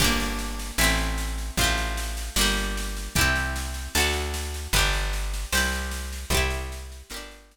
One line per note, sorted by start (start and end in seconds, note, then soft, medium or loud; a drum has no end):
0.00 0.72 G1 loud
0.00 0.77 D4 loud
0.00 0.77 G4 loud
0.00 kick loud
0.00 snare medium
0.00 crash medium
0.04 0.77 A#3 loud
0.20 snare medium
0.39 snare medium
0.59 snare medium
0.78 1.51 A1 loud
0.78 1.56 C4 loud
0.78 1.56 E4 medium
0.78 snare loud
0.84 1.56 A3 loud
0.99 snare medium
1.18 snare medium
1.38 snare medium
1.57 2.30 A1 loud
1.57 2.36 C4 loud
1.57 2.36 F4 loud
1.57 kick loud
1.57 snare medium
1.64 2.36 A3 medium
1.77 snare medium
1.97 snare medium
2.17 snare medium
2.36 3.09 G1 medium
2.36 3.13 A#3 medium
2.36 3.13 D4 medium
2.36 snare loud
2.41 3.13 G3 loud
2.57 snare medium
2.77 snare medium
2.97 snare medium
3.15 3.88 C2 medium
3.15 3.93 E4 loud
3.15 3.93 G4 loud
3.15 kick loud
3.15 snare medium
3.21 3.93 C4 loud
3.36 snare medium
3.56 snare medium
3.74 snare medium
3.95 4.68 D2 loud
3.95 4.73 F#4 loud
3.95 4.73 A4 loud
3.95 snare loud
4.00 4.73 D4 medium
4.13 snare medium
4.34 snare medium
4.54 snare medium
4.73 5.46 G1 loud
4.73 5.51 G4 loud
4.73 5.51 B4 loud
4.73 kick loud
4.73 snare medium
4.79 5.51 D4 medium
4.93 snare medium
5.13 snare medium
5.34 snare medium
5.52 6.25 C2 medium
5.52 6.30 G4 loud
5.52 6.30 C5 medium
5.52 snare loud
5.57 6.30 E4 medium
5.72 snare medium
5.91 snare medium
6.13 snare medium
6.30 7.03 C2 loud
6.30 7.09 C5 medium
6.30 kick loud
6.30 snare medium
6.35 7.09 E4 loud
6.35 7.09 G4 loud
6.50 snare medium
6.72 snare medium
6.92 snare medium
7.10 7.57 G1 medium
7.10 7.57 A#4 medium
7.10 snare loud
7.14 7.57 D4 loud
7.14 7.57 G4 loud
7.31 snare medium
7.51 snare medium